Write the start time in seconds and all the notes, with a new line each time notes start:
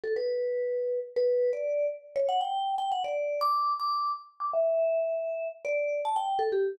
0.04 A4
0.16 B4
1.16 B4
1.53 D5
2.16 C#5
2.29 F#5
2.41 G5
2.78 G5
2.92 F#5
3.04 D5
3.41 D6
3.80 D6
4.40 D6
4.53 E5
5.65 D5
6.05 A5
6.16 G5
6.39 A4
6.52 G4